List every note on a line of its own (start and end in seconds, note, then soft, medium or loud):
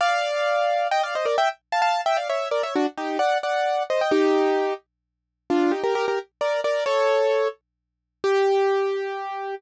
0.01 0.88 D5 medium
0.01 0.88 F5 medium
0.91 1.02 D#5 medium
0.91 1.02 G5 medium
1.03 1.14 D5 medium
1.03 1.14 F5 medium
1.15 1.26 C5 medium
1.15 1.26 D#5 medium
1.25 1.36 A#4 medium
1.25 1.36 D5 medium
1.38 1.49 E5 medium
1.38 1.49 G5 medium
1.72 1.81 F5 medium
1.72 1.81 A5 medium
1.82 2.01 F5 medium
1.82 2.01 A5 medium
2.06 2.17 E5 medium
2.06 2.17 G5 medium
2.17 2.28 D5 medium
2.17 2.28 F5 medium
2.29 2.48 C#5 medium
2.29 2.48 E5 medium
2.51 2.62 A#4 medium
2.51 2.62 D5 medium
2.63 2.74 C#5 medium
2.63 2.74 E5 medium
2.76 2.86 D4 medium
2.76 2.86 F#4 medium
2.98 3.18 D#4 medium
2.98 3.18 G4 medium
3.19 3.38 D5 medium
3.19 3.38 F#5 medium
3.43 3.83 D5 medium
3.43 3.83 F#5 medium
3.90 4.01 C5 medium
3.90 4.01 D#5 medium
4.01 4.12 D#5 medium
4.01 4.12 G5 medium
4.11 4.74 D#4 medium
4.11 4.74 G4 medium
5.50 5.72 D4 medium
5.50 5.72 F4 medium
5.72 5.82 D#4 medium
5.72 5.82 G4 medium
5.83 5.94 G4 medium
5.83 5.94 A#4 medium
5.95 6.06 G4 medium
5.95 6.06 A#4 medium
6.08 6.19 G4 medium
6.08 6.19 A#4 medium
6.41 6.61 A#4 medium
6.41 6.61 D5 medium
6.64 6.84 A#4 medium
6.64 6.84 D5 medium
6.86 7.48 A4 medium
6.86 7.48 C#5 medium
8.24 9.55 G4 loud